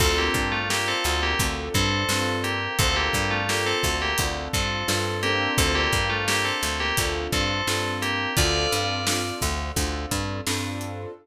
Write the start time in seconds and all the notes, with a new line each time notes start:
0.00 D2 C4 D4 F4 A4, kick, crash
0.18 A#3 G4
0.34 G2, kick, closed hi-hat
0.52 A3 F4
0.69 A#3 C4 D4 F4 G4 A4, snare
0.88 C4 A4
1.04 D2, snare, closed hi-hat
1.23 A#3 G4
1.39 D2 C4 D4 F4 A4, kick, closed hi-hat
1.74 G2 C4 A4, kick, closed hi-hat
2.09 G2 C4 D4 F4 A4, snare
2.44 A#3 G4, closed hi-hat
2.79 D2 C4 D4 F4 A4, kick, closed hi-hat
2.96 A#3 G4
3.13 G2, kick, closed hi-hat
3.31 A3 F4
3.49 A#3 C4 D4 F4 G4 A4, snare
3.66 C4 A4
3.83 D2, kick, snare, closed hi-hat
4.02 A#3 G4
4.18 D2 C4 D4 F4 A4, kick, closed hi-hat
4.53 G2 C4 A4, kick, closed hi-hat
4.88 G2 C4 D4 F4 A4, snare
5.23 A#3 C4 D4 F4 G4 A4, closed hi-hat
5.58 D2 C4 A4, kick, closed hi-hat
5.75 A#3 G4
5.92 G2, kick, closed hi-hat
6.10 A3 F4
6.28 A#3 C4 D4 F4 G4 A4, snare
6.45 C4 A4
6.63 D2, snare, closed hi-hat
6.80 A#3 G4
6.97 D2 C4 D4 F4 A4, kick, closed hi-hat
7.32 G2 C4 A4, kick, closed hi-hat
7.67 G2 C4 D4 F4 A4, snare
8.02 A#3 G4, closed hi-hat
8.37 D2 C4 D4 F4 A4 D5, kick, closed hi-hat
8.72 G2, closed hi-hat
9.07 C4 D4 F4 A4, snare
9.41 D2, kick, snare, closed hi-hat
9.76 D2 C4 D4 F4 A4, kick, closed hi-hat
10.11 G2, kick, closed hi-hat
10.46 G2 C4 D4 F4 A4, snare
10.81 closed hi-hat